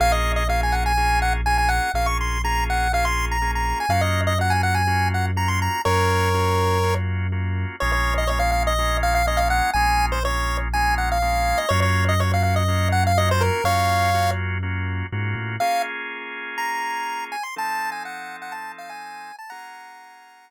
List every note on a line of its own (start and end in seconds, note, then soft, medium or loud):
0.00 1.80 A#1 medium
0.00 0.43 A#3 medium
0.00 0.43 C#4 medium
0.00 0.43 F4 medium
0.00 0.43 G#4 loud
0.00 0.12 F5 loud
0.12 0.32 D#5 medium
0.36 0.48 D#5 medium
0.49 0.92 A#3 medium
0.49 0.92 C#4 medium
0.49 0.92 F4 medium
0.49 0.92 G#4 medium
0.49 0.61 F5 medium
0.63 0.75 G#5 medium
0.72 0.84 F#5 medium
0.86 1.20 G#5 loud
0.97 1.41 A#3 medium
0.97 1.41 C#4 medium
0.97 1.41 F4 medium
0.97 1.41 G#4 medium
1.22 1.33 F#5 medium
1.46 1.90 A#3 medium
1.46 1.90 C#4 medium
1.46 1.90 F4 medium
1.46 1.90 G#4 medium
1.46 1.57 G#5 medium
1.58 1.70 G#5 medium
1.69 1.92 F#5 medium
1.94 3.73 A#1 medium
1.94 2.38 A#3 medium
1.94 2.38 C#4 medium
1.94 2.38 F4 medium
1.94 2.38 G#4 medium
1.94 2.07 F5 loud
2.06 2.18 C#6 medium
2.21 2.42 C6 medium
2.44 2.88 A#3 medium
2.44 2.88 C#4 medium
2.44 2.88 F4 medium
2.44 2.88 G#4 medium
2.44 2.64 A#5 medium
2.70 2.92 F#5 medium
2.93 3.37 A#3 medium
2.93 3.37 C#4 medium
2.93 3.37 F4 medium
2.93 3.37 G#4 medium
2.93 3.05 F5 medium
3.05 3.26 C6 medium
3.31 3.51 A#5 medium
3.42 3.86 A#3 medium
3.42 3.86 C#4 medium
3.42 3.86 F4 medium
3.42 3.86 G#4 medium
3.55 3.79 A#5 medium
3.80 3.92 G#5 medium
3.89 5.68 F#2 medium
3.89 4.33 A#3 medium
3.89 4.33 C#4 medium
3.89 4.33 F4 medium
3.89 4.33 F#4 medium
3.89 4.01 F5 medium
4.01 4.21 D#5 medium
4.27 4.38 D#5 medium
4.39 4.83 A#3 medium
4.39 4.83 C#4 medium
4.39 4.83 F4 medium
4.39 4.83 F#4 medium
4.39 4.53 F#5 medium
4.50 4.62 G#5 medium
4.63 4.75 F#5 medium
4.75 5.09 G#5 medium
4.87 5.31 A#3 medium
4.87 5.31 C#4 medium
4.87 5.31 F4 medium
4.87 5.31 F#4 medium
5.14 5.26 F#5 medium
5.36 5.80 A#3 medium
5.36 5.80 C#4 medium
5.36 5.80 F4 medium
5.36 5.80 F#4 medium
5.36 5.49 A#5 medium
5.48 5.60 C6 medium
5.62 5.82 A#5 medium
5.85 7.65 F#2 medium
5.85 6.29 A#3 medium
5.85 6.29 C#4 medium
5.85 6.29 F4 medium
5.85 6.29 F#4 medium
5.85 6.94 A#4 medium
5.85 6.94 C#5 loud
6.34 6.78 A#3 medium
6.34 6.78 C#4 medium
6.34 6.78 F4 medium
6.34 6.78 F#4 medium
6.83 7.27 A#3 medium
6.83 7.27 C#4 medium
6.83 7.27 F4 medium
6.83 7.27 F#4 medium
7.32 7.76 A#3 medium
7.32 7.76 C#4 medium
7.32 7.76 F4 medium
7.32 7.76 F#4 medium
7.80 9.62 A#1 medium
7.80 8.24 G#3 medium
7.80 8.24 A#3 medium
7.80 8.24 C#4 medium
7.80 8.24 F4 medium
7.80 7.92 C#5 loud
7.92 8.14 C#5 loud
8.18 8.29 D#5 loud
8.27 8.73 G#3 medium
8.27 8.73 A#3 medium
8.27 8.73 C#4 medium
8.27 8.73 F4 medium
8.27 8.39 C#5 loud
8.39 8.51 F5 medium
8.52 8.63 F5 medium
8.67 8.97 D#5 loud
8.78 9.22 G#3 medium
8.78 9.22 A#3 medium
8.78 9.22 C#4 medium
8.78 9.22 F4 medium
9.03 9.14 F5 loud
9.15 9.26 F5 loud
9.27 9.71 G#3 medium
9.27 9.71 A#3 medium
9.27 9.71 C#4 medium
9.27 9.71 F4 medium
9.27 9.39 D#5 loud
9.37 9.48 F5 loud
9.50 9.71 F#5 loud
9.73 11.54 A#1 medium
9.73 10.19 G#3 medium
9.73 10.19 A#3 medium
9.73 10.19 C#4 medium
9.73 10.19 F4 medium
9.73 10.06 G#5 loud
10.12 10.23 C5 medium
10.24 10.68 G#3 medium
10.24 10.68 A#3 medium
10.24 10.68 C#4 medium
10.24 10.68 F4 medium
10.24 10.57 C#5 loud
10.73 11.18 G#3 medium
10.73 11.18 A#3 medium
10.73 11.18 C#4 medium
10.73 11.18 F4 medium
10.73 10.95 G#5 loud
10.98 11.09 F#5 medium
11.12 11.59 F5 loud
11.22 11.66 G#3 medium
11.22 11.66 A#3 medium
11.22 11.66 C#4 medium
11.22 11.66 F4 medium
11.58 11.69 D#5 medium
11.69 13.50 F#2 loud
11.69 12.14 A#3 medium
11.69 12.14 C#4 medium
11.69 12.14 F4 loud
11.69 12.14 F#4 medium
11.69 11.80 C#5 loud
11.82 12.05 C#5 medium
12.09 12.20 D#5 medium
12.19 12.63 A#3 medium
12.19 12.63 C#4 medium
12.19 12.63 F4 medium
12.19 12.63 F#4 medium
12.19 12.32 C#5 medium
12.34 12.43 F5 medium
12.43 12.55 F5 medium
12.56 12.89 D#5 medium
12.68 13.12 A#3 medium
12.68 13.12 C#4 medium
12.68 13.12 F4 medium
12.68 13.12 F#4 medium
12.92 13.04 F#5 loud
13.07 13.18 F5 medium
13.17 13.61 A#3 medium
13.17 13.61 C#4 medium
13.17 13.61 F4 medium
13.17 13.61 F#4 medium
13.17 13.29 D#5 loud
13.31 13.43 C5 loud
13.41 13.64 A#4 medium
13.64 15.03 F#2 medium
13.64 14.10 A#3 medium
13.64 14.10 C#4 medium
13.64 14.10 F4 medium
13.64 14.10 F#4 medium
13.64 14.31 C#5 loud
13.64 14.31 F5 loud
14.14 14.58 A#3 medium
14.14 14.58 C#4 medium
14.14 14.58 F4 medium
14.14 14.58 F#4 medium
14.63 15.07 A#3 medium
14.63 15.07 C#4 medium
14.63 15.07 F4 medium
14.63 15.07 F#4 medium
15.12 15.34 G#2 medium
15.12 15.56 A#3 medium
15.12 15.56 C#4 medium
15.12 15.56 F4 medium
15.12 15.56 F#4 medium
15.35 15.57 A2 medium
15.60 17.36 A#3 medium
15.60 17.36 C#4 medium
15.60 17.36 F4 medium
15.60 17.36 G#4 medium
15.60 15.82 F5 loud
16.58 17.24 A#5 medium
17.32 17.43 G#5 medium
17.43 17.55 C6 medium
17.56 19.32 F3 medium
17.56 19.32 C4 medium
17.56 19.32 D#4 loud
17.56 19.32 A4 loud
17.56 17.90 A5 loud
17.92 18.03 G#5 medium
18.05 18.36 F#5 medium
18.42 18.53 F#5 medium
18.52 18.72 A5 loud
18.78 18.90 F5 medium
18.89 19.36 G#5 medium
19.39 19.50 A5 loud
19.50 20.50 A#3 medium
19.50 20.50 C#4 medium
19.50 20.50 F4 medium
19.50 20.50 G#4 medium
19.50 20.50 F#5 medium
19.50 20.50 A#5 loud